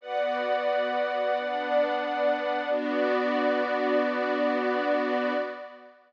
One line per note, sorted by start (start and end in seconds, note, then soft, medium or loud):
0.01 1.34 B3 medium
0.01 1.34 F#4 medium
0.01 2.69 B4 medium
0.01 1.34 D5 medium
0.01 2.69 D5 medium
0.01 2.69 F#5 medium
1.35 2.69 B3 medium
1.35 2.69 D4 medium
1.35 2.69 D5 medium
2.70 5.33 B3 loud
2.70 5.33 D4 loud
2.70 5.33 F#4 loud
2.70 5.33 D5 loud